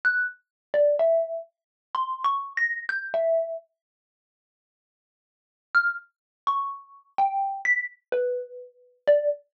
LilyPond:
\new Staff { \time 2/4 \tempo 4 = 63 ges'''16 r8 d''16 e''8 r8 | \tuplet 3/2 { c'''8 des'''8 bes'''8 } g'''16 e''8 r16 | r2 | f'''16 r8 des'''8. g''8 |
b'''16 r16 b'4 d''16 r16 | }